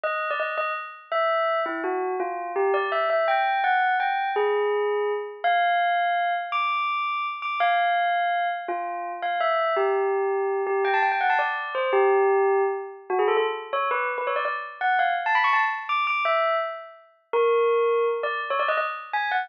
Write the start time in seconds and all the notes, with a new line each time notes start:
0.04 D#5
0.31 D5
0.40 D#5
0.58 D#5
1.12 E5
1.66 E4
1.84 F#4
2.20 F4
2.56 G4
2.74 D5
2.92 E5
3.10 E5
3.28 G5
3.64 F#5
4.00 G5
4.36 G#4
5.44 F5
6.52 D6
7.42 D6
7.60 F5
8.68 F4
9.22 F5
9.40 E5
9.77 G4
10.67 G4
10.85 G5
10.94 A5
11.03 G5
11.12 G5
11.21 F#5
11.30 A5
11.39 D5
11.75 C5
11.93 G4
13.10 F#4
13.19 G#4
13.28 A4
13.37 A4
13.73 C#5
13.91 B4
14.18 B4
14.27 C#5
14.36 D5
14.45 D5
14.81 F#5
14.99 F5
15.26 A5
15.35 B5
15.44 C#6
15.53 A5
15.89 D6
16.07 D6
16.25 E5
17.33 A#4
18.23 D5
18.50 C#5
18.59 D5
18.68 D#5
18.77 D#5
19.13 G#5
19.31 F#5